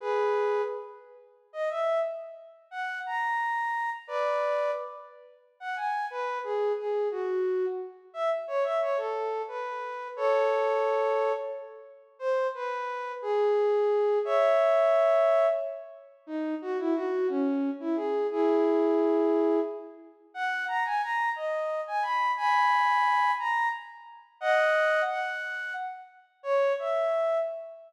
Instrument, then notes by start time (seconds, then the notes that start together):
flute
0.01 G#4 B4
1.53 D#5
1.70 E5
2.71 F#5
3.06 A#5
4.07 B4 D5
5.60 F#5
5.76 G#5
6.10 B4
6.44 G#4
6.78 G#4
7.11 F#4
8.14 E5
8.47 C#5
8.64 E5
8.81 C#5
8.97 A4
9.48 B4
10.16 A4 C#5
12.19 C5
12.55 B4
13.22 G#4
14.25 C#5 E5
16.27 D#4
16.62 F#4
16.79 E4
16.94 F#4
17.29 C#4
17.80 E4
17.96 G#4
18.31 E4 G#4
20.34 F#5
20.68 A#5
20.85 G#5
21.02 A#5
21.36 D#5
21.87 G#5
22.02 B5
22.37 G#5 B5
23.39 A#5
24.41 D#5 F#5
25.09 F#5
26.43 C#5
26.79 E5